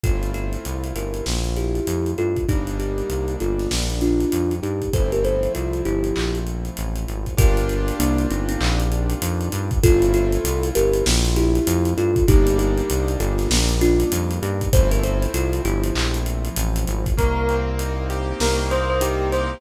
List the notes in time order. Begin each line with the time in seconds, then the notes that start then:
0.03 G1 A3 C4 E4 F4 A4, kick, closed hi-hat
0.23 closed hi-hat
0.34 F4 A4, closed hi-hat
0.53 closed hi-hat
0.65 C2, closed hi-hat
0.84 closed hi-hat
0.95 G1 G4 A#4, closed hi-hat
1.14 closed hi-hat
1.26 A#1, snare
1.44 closed hi-hat
1.56 E4 G4, closed hi-hat
1.75 closed hi-hat
1.87 F2, closed hi-hat
2.06 closed hi-hat
2.18 G2 F4 A4, closed hi-hat
2.36 kick, closed hi-hat
2.48 G1 G3 A#3 D4 D#4 G4, kick, closed hi-hat
2.67 closed hi-hat
2.79 D#4 G4, closed hi-hat
2.98 closed hi-hat
3.10 C2, closed hi-hat
3.28 closed hi-hat
3.40 G1 F4 A4, closed hi-hat
3.59 snare, closed hi-hat
3.71 A#1, snare
3.90 closed hi-hat
4.01 D4 F4, closed hi-hat
4.20 closed hi-hat
4.32 F2, closed hi-hat
4.51 closed hi-hat
4.63 G2 D#4 G4, closed hi-hat
4.82 kick, closed hi-hat
4.93 G1 F3 A3 C4 E4 A4 C5, kick, closed hi-hat
5.12 G4 A#4, closed hi-hat
5.24 A4 C5, closed hi-hat
5.43 closed hi-hat
5.55 C2 F4 A4, closed hi-hat
5.73 closed hi-hat
5.85 G1 E4 G4, closed hi-hat
6.04 closed hi-hat
6.16 A#1, clap
6.35 closed hi-hat
6.47 closed hi-hat
6.65 closed hi-hat
6.77 A1, closed hi-hat
6.96 closed hi-hat
7.08 G#1, closed hi-hat
7.26 kick, closed hi-hat
7.37 G1 A#3 D4 F4 G4 A#4, kick, closed hi-hat
7.57 closed hi-hat
7.69 closed hi-hat
7.88 closed hi-hat
7.99 C2 A#3 D4, closed hi-hat
8.18 closed hi-hat
8.30 G1 C4 D#4, closed hi-hat
8.49 C4 D#4, closed hi-hat
8.61 A#1, clap
8.80 closed hi-hat
8.92 closed hi-hat
9.10 closed hi-hat
9.22 F2, closed hi-hat
9.41 closed hi-hat
9.52 G2, closed hi-hat
9.71 kick, closed hi-hat
9.83 G1 A3 C4 E4 F4 A4, kick, closed hi-hat
10.02 closed hi-hat
10.14 F4 A4, closed hi-hat
10.32 closed hi-hat
10.44 C2, closed hi-hat
10.63 closed hi-hat
10.75 G1 G4 A#4, closed hi-hat
10.93 closed hi-hat
11.06 A#1, snare
11.25 closed hi-hat
11.36 E4 G4, closed hi-hat
11.55 closed hi-hat
11.67 F2, closed hi-hat
11.85 closed hi-hat
11.97 G2 F4 A4, closed hi-hat
12.16 kick, closed hi-hat
12.28 G1 G3 A#3 D4 D#4 G4, kick, closed hi-hat
12.47 closed hi-hat
12.59 D#4 G4, closed hi-hat
12.77 closed hi-hat
12.90 C2, closed hi-hat
13.08 closed hi-hat
13.20 G1 F4 A4, closed hi-hat
13.38 snare, closed hi-hat
13.50 A#1, snare
13.69 closed hi-hat
13.81 D4 F4, closed hi-hat
14.00 closed hi-hat
14.12 F2, closed hi-hat
14.31 closed hi-hat
14.42 G2 D#4 G4, closed hi-hat
14.61 kick, closed hi-hat
14.73 G1 F3 A3 C4 E4 A4 C5, kick, closed hi-hat
14.91 G4 A#4, closed hi-hat
15.03 A4 C5, closed hi-hat
15.22 closed hi-hat
15.34 C2 F4 A4, closed hi-hat
15.53 closed hi-hat
15.65 G1 E4 G4, closed hi-hat
15.83 closed hi-hat
15.95 A#1, clap
16.14 closed hi-hat
16.26 closed hi-hat
16.45 closed hi-hat
16.56 A1, closed hi-hat
16.76 closed hi-hat
16.87 G#1, closed hi-hat
17.06 kick, closed hi-hat
17.17 C2 A#3 A#4, kick, closed hi-hat
17.49 C4, closed hi-hat
17.79 D#4, closed hi-hat
18.10 G4, closed hi-hat
18.40 C2 A#3 A#4, snare
18.71 C4 C5, closed hi-hat
18.90 C5
19.01 D#4 G4, closed hi-hat
19.32 G4 C5, closed hi-hat